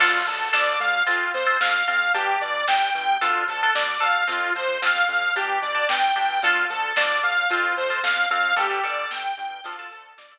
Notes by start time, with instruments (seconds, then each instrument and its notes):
0.00 synth bass 1 D2, overdriven guitar D4 F4 A4, lead 2 (sawtooth) F4, kick, crash
0.14 kick
0.27 synth bass 1 D2, lead 2 (sawtooth) A4, kick, closed hi-hat
0.40 kick
0.53 synth bass 1 D2, overdriven guitar D4 F4 A4, lead 2 (sawtooth) D5, kick, snare
0.67 kick
0.80 synth bass 1 D2, lead 2 (sawtooth) F5, kick, closed hi-hat
0.94 kick
1.07 synth bass 1 F2, overdriven guitar C4 F4, lead 2 (sawtooth) F4, kick, closed hi-hat
1.21 kick
1.34 synth bass 1 F2, lead 2 (sawtooth) C5, kick, closed hi-hat
1.46 overdriven guitar C4 F4, kick
1.60 synth bass 1 F2, lead 2 (sawtooth) F5, kick, snare
1.74 kick
1.87 synth bass 1 F2, overdriven guitar C4 F4, lead 2 (sawtooth) F5, kick, closed hi-hat
2.01 kick
2.14 synth bass 1 G1, overdriven guitar D4 G4, lead 2 (sawtooth) G4, kick, closed hi-hat
2.27 kick
2.41 synth bass 1 G1, lead 2 (sawtooth) D5, kick, closed hi-hat
2.54 kick
2.67 synth bass 1 G1, overdriven guitar D4 G4, lead 2 (sawtooth) G5, kick, snare
2.81 kick
2.94 synth bass 1 G1, lead 2 (sawtooth) G5, kick, closed hi-hat
3.08 kick
3.21 synth bass 1 D2, overdriven guitar D4 F4 A4, lead 2 (sawtooth) F4, kick, closed hi-hat
3.35 kick
3.48 synth bass 1 D2, lead 2 (sawtooth) A4, kick, closed hi-hat
3.61 overdriven guitar D4 F4 A4, kick
3.74 synth bass 1 D2, lead 2 (sawtooth) D5, kick, snare
3.88 kick
4.00 synth bass 1 D2, overdriven guitar D4 F4 A4, lead 2 (sawtooth) F5, kick, closed hi-hat
4.15 kick
4.27 synth bass 1 F2, overdriven guitar C4 F4, lead 2 (sawtooth) F4, kick, closed hi-hat
4.42 kick
4.55 synth bass 1 F2, lead 2 (sawtooth) C5, kick, closed hi-hat
4.68 kick
4.82 synth bass 1 F2, overdriven guitar C4 F4, lead 2 (sawtooth) F5, kick, snare
4.96 kick
5.08 synth bass 1 F2, lead 2 (sawtooth) F5, kick, closed hi-hat
5.22 kick
5.36 synth bass 1 G1, overdriven guitar D4 G4, lead 2 (sawtooth) G4, kick, closed hi-hat
5.49 kick
5.62 synth bass 1 G1, lead 2 (sawtooth) D5, kick, closed hi-hat
5.75 overdriven guitar D4 G4, kick
5.89 synth bass 1 G1, lead 2 (sawtooth) G5, kick, snare
6.03 kick
6.16 synth bass 1 G1, overdriven guitar D4 G4, lead 2 (sawtooth) G5, kick, open hi-hat
6.30 kick
6.42 synth bass 1 D2, overdriven guitar D4 F4 A4, lead 2 (sawtooth) F4, kick, closed hi-hat
6.56 kick
6.70 synth bass 1 D2, lead 2 (sawtooth) A4, kick, closed hi-hat
6.83 kick
6.96 synth bass 1 D2, overdriven guitar D4 F4 A4, lead 2 (sawtooth) D5, kick, snare
7.10 kick
7.23 synth bass 1 D2, lead 2 (sawtooth) F5, kick, closed hi-hat
7.37 kick
7.50 synth bass 1 F2, overdriven guitar C4 F4, lead 2 (sawtooth) F4, kick, closed hi-hat
7.64 kick
7.77 synth bass 1 F2, lead 2 (sawtooth) C5, kick
7.90 overdriven guitar C4 F4, kick
8.03 synth bass 1 F2, lead 2 (sawtooth) F5, kick, snare
8.17 kick
8.30 synth bass 1 F2, overdriven guitar C4 F4, lead 2 (sawtooth) F5, kick, closed hi-hat
8.44 kick
8.56 synth bass 1 G1, overdriven guitar D3 G3, lead 2 (sawtooth) G4, kick, closed hi-hat
8.70 overdriven guitar D3 G3, kick
8.83 synth bass 1 G1, overdriven guitar D3 G3, lead 2 (sawtooth) D5, kick, closed hi-hat
8.98 kick
9.11 synth bass 1 G1, lead 2 (sawtooth) G5, kick, snare
9.24 kick
9.37 synth bass 1 G1, lead 2 (sawtooth) G5, kick, closed hi-hat
9.51 kick
9.64 synth bass 1 D2, overdriven guitar D3 F3 A3, lead 2 (sawtooth) F4, kick, closed hi-hat
9.78 overdriven guitar D3 F3 A3, kick
9.91 synth bass 1 D2, lead 2 (sawtooth) A4, kick, closed hi-hat
10.04 kick
10.18 synth bass 1 D2, lead 2 (sawtooth) D5, kick, snare
10.31 overdriven guitar D3 F3 A3, kick